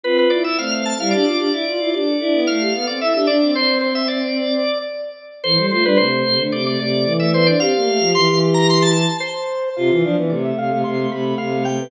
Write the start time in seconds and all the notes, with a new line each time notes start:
0.03 C4 F4 B4
0.18 B4
0.30 E4 D5
0.44 E4 E5
0.58 A3 C4 F5
0.71 F5
0.85 A5
0.98 G3 E4 F5
1.11 D4 G4 D5
1.25 D4 F4
1.37 D4 G4
1.52 E4
1.66 F4
1.78 E4 F4
1.93 D4 G4 D5
2.06 A4
2.20 D4 E4
2.33 B3
2.47 A3 F5
2.60 G4
2.73 B3 A4
2.87 C4 D5
3.00 E4 E5
3.14 D4 G4 E5
3.27 D4 D5
3.41 C4
3.55 C4 C5
3.81 C5
3.95 E5
4.08 D5
5.44 E3 A4 C5
5.56 G3 A4
5.70 A3 F4 C5
5.83 G3 D4 B4
5.97 C3 A3 C5
6.25 C3
6.38 D3 A3
6.52 C3 D5
6.66 A3 D5
6.79 C3 A3 D5
7.04 E3
7.20 A3 E5
7.33 B3 C5
7.47 D4 D5
7.59 C4 G4 F5
7.75 A#3
7.86 A3
7.99 F3
8.14 E3 C6
8.27 E3
8.54 A#5
8.70 C6
8.82 A5
9.20 C5
9.76 C3 F4 F5
9.90 E3 F4 F5
10.03 F3 D4 F5
10.17 E3 B3
10.29 C3 A3 D5
10.45 E5
10.58 C3 F5
10.71 C3 A3
10.84 C3 C6
10.98 A3
11.10 C3 A3 B5
11.38 C3 F5
11.52 A3
11.65 A3 G5
11.79 B3